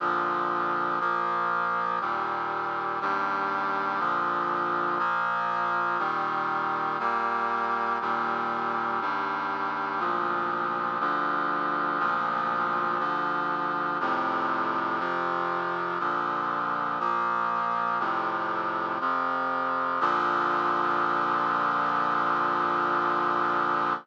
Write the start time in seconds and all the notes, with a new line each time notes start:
0.00 A#2 D3 F3
1.00 A#2 F3 A#3
2.01 D#2 A#2 G3
3.01 D#2 G2 G3
3.99 A#2 D3 F3
4.99 A#2 F3 A#3
5.99 A#2 D#3 G3
6.99 A#2 G3 A#3
8.01 D#2 A#2 G3
9.01 D#2 G2 G3
9.99 D2 A#2 F3
11.00 D2 D3 F3
11.99 D2 A#2 F3
12.99 D2 D3 F3
14.00 F2 A2 C3
14.99 F2 C3 F3
15.99 A#2 D3 F3
17.00 A#2 F3 A#3
17.99 F2 A2 C3
19.00 F2 C3 F3
20.00 A#2 D3 F3